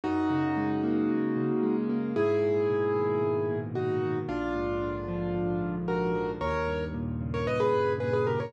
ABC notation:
X:1
M:4/4
L:1/16
Q:1/4=113
K:G#m
V:1 name="Acoustic Grand Piano"
[DF]14 z2 | [EG]12 [DF]4 | [=D^E]12 [FA]4 | [Ac]4 z3 [Ac] [Bd] [GB]3 [GB] [GB] [=GA] [Ac] |]
V:2 name="Acoustic Grand Piano"
F,,2 C,2 G,2 A,2 F,,2 C,2 G,2 A,2 | G,,2 A,,2 B,,2 D,2 G,,2 A,,2 B,,2 D,2 | A,,,2 G,,2 =D,2 ^E,2 A,,,2 G,,2 D,2 E,2 | D,,2 =G,,2 A,,2 C,2 D,,2 G,,2 A,,2 C,2 |]